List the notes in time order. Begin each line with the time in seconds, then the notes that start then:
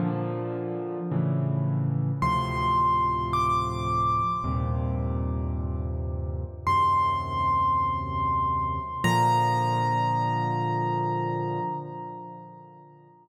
0.00 A#2 D3 F3
1.11 A2 C#3 E3
2.22 D2 A2 C3 F3 C6
3.33 D6
4.44 D#2 G2 A#2 C3
6.67 D#2 F#2 C3 C6
9.04 A#2 D3 F3 A#5